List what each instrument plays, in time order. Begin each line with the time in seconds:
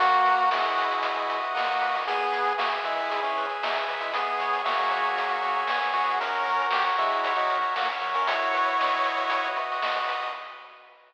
0.00 synth bass 1 B1, lead 1 (square) A#3 F#4, kick, closed hi-hat
0.12 kick, closed hi-hat
0.26 synth bass 1 B2, lead 1 (square) B4, closed hi-hat
0.38 closed hi-hat
0.51 synth bass 1 B1, lead 1 (square) G#3 E4 D#5, snare
0.65 kick, closed hi-hat
0.77 synth bass 1 B2, lead 1 (square) B4, closed hi-hat
0.91 closed hi-hat
1.03 synth bass 1 B1, lead 1 (square) F#4, kick, closed hi-hat
1.16 closed hi-hat
1.29 synth bass 1 B2, lead 1 (square) B4, closed hi-hat
1.41 closed hi-hat
1.55 synth bass 1 B1, lead 1 (square) A#3 F#4 D#5, snare
1.66 closed hi-hat
1.80 synth bass 1 B2, lead 1 (square) B4, closed hi-hat
1.95 open hi-hat
2.05 synth bass 1 E2, lead 1 (square) B3 G#4, kick, closed hi-hat
2.20 kick, closed hi-hat
2.32 synth bass 1 E3, lead 1 (square) B4, closed hi-hat
2.45 closed hi-hat
2.58 synth bass 1 E2, lead 1 (square) A#3 F#4 E5, snare
2.73 closed hi-hat
2.84 synth bass 1 E3, lead 1 (square) G#3 E4 B4, closed hi-hat
2.98 closed hi-hat
3.10 synth bass 1 E2, lead 1 (square) G#4, kick, closed hi-hat
3.23 lead 1 (square) E3 C#4, closed hi-hat
3.36 synth bass 1 E3, lead 1 (square) B4, closed hi-hat
3.49 closed hi-hat
3.62 synth bass 1 E2, lead 1 (square) F#3 D#4 E5, snare
3.75 closed hi-hat
3.88 synth bass 1 E3, lead 1 (square) B4, closed hi-hat
4.01 lead 1 (square) G#3 E4, closed hi-hat
4.13 synth bass 1 C#2, lead 1 (square) B3 G#4, kick, closed hi-hat
4.27 closed hi-hat
4.39 synth bass 1 C#3, lead 1 (square) C#5, closed hi-hat
4.53 closed hi-hat
4.64 synth bass 1 C#2, lead 1 (square) A#3 F#4 E5, snare
4.78 kick, closed hi-hat
4.91 synth bass 1 C#3, lead 1 (square) C#5, closed hi-hat
5.04 closed hi-hat
5.17 synth bass 1 C#2, lead 1 (square) G#4, kick, closed hi-hat
5.29 closed hi-hat
5.42 synth bass 1 C#3, lead 1 (square) C#5, closed hi-hat
5.56 closed hi-hat
5.67 synth bass 1 C#2, lead 1 (square) B3 G#4 E5, snare
5.80 closed hi-hat
5.93 synth bass 1 F#2, lead 1 (square) F#4, closed hi-hat
6.08 closed hi-hat
6.21 lead 1 (square) C#4 A#4, kick, closed hi-hat
6.33 kick, closed hi-hat
6.46 synth bass 1 F#3, lead 1 (square) A#4, closed hi-hat
6.59 closed hi-hat
6.71 synth bass 1 F#2, lead 1 (square) G4 C#5, snare
6.87 closed hi-hat
6.98 synth bass 1 F#3, lead 1 (square) G#3 E4 E5, closed hi-hat
7.12 closed hi-hat
7.23 synth bass 1 F#2, lead 1 (square) C#5, kick, closed hi-hat
7.36 lead 1 (square) F#3 D#4, closed hi-hat
7.50 synth bass 1 F#3, lead 1 (square) A#4, closed hi-hat
7.62 closed hi-hat
7.75 synth bass 1 F#2, lead 1 (square) A#3 F#4, snare
7.88 closed hi-hat
8.01 synth bass 1 F#3, lead 1 (square) A#4, closed hi-hat
8.14 lead 1 (square) C#4 A#4, closed hi-hat
8.27 synth bass 1 B1, lead 1 (square) E4 F#4 C#5, kick, closed hi-hat
8.41 kick, closed hi-hat
8.54 synth bass 1 B2, lead 1 (square) B4, closed hi-hat
8.67 closed hi-hat
8.79 synth bass 1 B1, lead 1 (square) D#5, snare
8.93 kick, closed hi-hat
9.04 synth bass 1 B2, lead 1 (square) B4, closed hi-hat
9.17 closed hi-hat
9.30 synth bass 1 B1, lead 1 (square) F#4, kick, closed hi-hat
9.45 closed hi-hat
9.56 synth bass 1 B2, lead 1 (square) B4, closed hi-hat
9.72 closed hi-hat
9.82 synth bass 1 B1, lead 1 (square) D#5, snare
9.95 closed hi-hat
10.08 synth bass 1 B2, lead 1 (square) B4, closed hi-hat
10.23 closed hi-hat